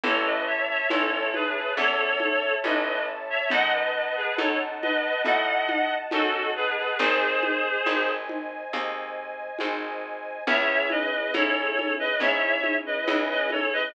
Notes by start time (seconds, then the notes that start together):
0.03 A1 C#4 E4 A4 C#5 E5 A5, low conga
0.25 B4 D#5
0.47 C#5 E5
0.69 C#5 E5
0.90 A1 C#4 E4 A4 C#5, high conga
1.12 A4 C#5
1.34 G#4 B4, high conga
1.77 E2 C#4 E4 A4 C#5, low conga
2.20 high conga
2.64 A1 C#4 E4 A4 B4 D#5, high conga
3.30 C#5 E5
3.50 F#2 D#4 F#4 A4 D#5 F#5 A5, low conga
3.73 B4 D#5
3.95 B4 D#5
4.16 G#4 B4
4.38 F#2 D#4 F#4 A4 C#5, high conga
4.82 B4 D#5, high conga
5.24 A2 D#4 F#4 A4 D#5 F#5, low conga
5.69 high conga
6.11 F#2 D#4 F#4 A4, high conga
6.56 G#4 B4
6.78 G#4 B4
6.99 G#1 C4 D#4 G#4 C5 D#5 G#5, low conga
7.43 high conga
7.86 G#1 C4 D#4 G#4, high conga
8.29 high conga
8.73 D#2 C4 D#4 G#4, low conga
9.59 G#1 C4 D#4 G#4, high conga
10.47 C#2 C#4 E4 G#4 C#5 E5, low conga
10.90 B4 D#5, high conga
11.34 G#2 C#4 E4 G#4 A4 C#5, high conga
11.79 high conga
11.99 B4 D#5
12.20 G#2 C#4 E4 G#4 C#5 E5, low conga
12.64 high conga
12.86 B4 D#5
13.07 C#2 C#4 E4 G#4, high conga
13.30 B4 D#5
13.50 A4 C#5, high conga
13.73 B4 D#5